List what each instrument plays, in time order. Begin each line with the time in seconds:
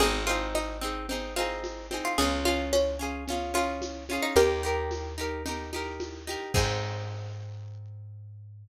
0.00 electric bass (finger) G#1, orchestral harp C4 D#4 G#4, pizzicato strings G#4, low conga, shaker
0.27 orchestral harp C4 D#4 G#4, pizzicato strings F4, high conga, shaker
0.55 pizzicato strings D#4, high conga, shaker
0.81 orchestral harp C4 D#4 G#4, shaker
1.09 orchestral harp C4 D#4 G#4, low conga, shaker
1.36 orchestral harp C4 D#4 G#4, pizzicato strings F4, high conga, shaker
1.64 high conga, shaker
1.91 orchestral harp C4 D#4 G#4, high conga, shaker
2.05 pizzicato strings F4
2.18 electric bass (finger) C#2, orchestral harp C#4 F4, pizzicato strings G#4, low conga, shaker
2.22 orchestral harp G#4
2.45 orchestral harp C#4 F4 G#4, pizzicato strings F4, high conga, shaker
2.73 pizzicato strings C#4, high conga, shaker
2.99 orchestral harp C#4 F4 G#4, shaker
3.27 orchestral harp C#4 F4, low conga, shaker
3.32 orchestral harp G#4
3.54 orchestral harp C#4 F4 G#4, pizzicato strings F4, high conga, shaker
3.82 high conga, shaker
4.09 orchestral harp C#4 F4 G#4, high conga, shaker
4.23 pizzicato strings D#4
4.36 electric bass (finger) D#2, orchestral harp D#4 G4, pizzicato strings G4 A#4, low conga, shaker
4.41 orchestral harp A#4
4.63 orchestral harp D#4 G4 A#4, shaker
4.91 high conga, shaker
5.18 orchestral harp D#4 G4 A#4, shaker
5.45 orchestral harp D#4 G4 A#4, low conga, shaker
5.73 orchestral harp D#4 G4 A#4, high conga, shaker
6.00 high conga, shaker
6.27 orchestral harp D#4 G4 A#4, high conga, shaker
6.54 electric bass (finger) G#2, orchestral harp C4 D#4 G#4, pizzicato strings G#4, kick, crash